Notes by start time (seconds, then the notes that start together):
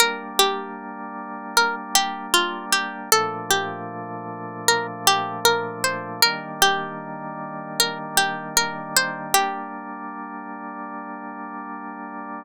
0.00 G3 A#3 D4 A#4
0.39 G4
1.57 A#4
1.95 G4
2.34 F4
2.72 G4
3.12 A#2 F3 A3 D4 A4
3.50 G4
4.68 A#4
5.07 G4
5.45 A#4
5.84 C5
6.22 D#3 G3 A#3 D4 A#4
6.62 G4
7.80 A#4
8.17 G4
8.57 A#4
8.97 C5
9.34 G3 A#3 D4 G4